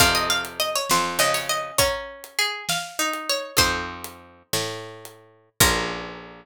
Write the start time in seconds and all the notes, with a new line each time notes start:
0.00 F2 C3 C5 D#5 F5 A5, kick, crash
0.15 D#5
0.30 F5
0.45 closed hi-hat
0.60 D#5
0.75 C#5
0.90 F2 C5, snare
1.19 C#3 D#5
1.34 C#5, open hi-hat
1.49 D#5
1.78 C#4 C#5 F#5 A#5, kick, closed hi-hat
2.24 closed hi-hat
2.39 G#4
2.69 F5, snare
2.99 D#4
3.13 closed hi-hat
3.29 C#5
3.57 F2 C4 D#4 F4 A4 C5, kick, closed hi-hat
4.04 closed hi-hat
4.53 A2, snare
5.05 closed hi-hat
5.60 A#1 A#3 C#4 F4 A#4, kick, crash